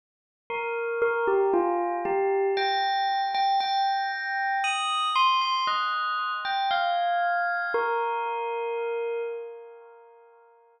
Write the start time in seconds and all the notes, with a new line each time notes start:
0.50 A#4
1.02 A#4
1.27 G4
1.53 F4
2.05 G4
2.57 G5
3.34 G5
3.60 G5
4.64 D#6
5.16 C6
5.41 C6
5.67 D#5
6.45 G5
6.71 F5
7.74 A#4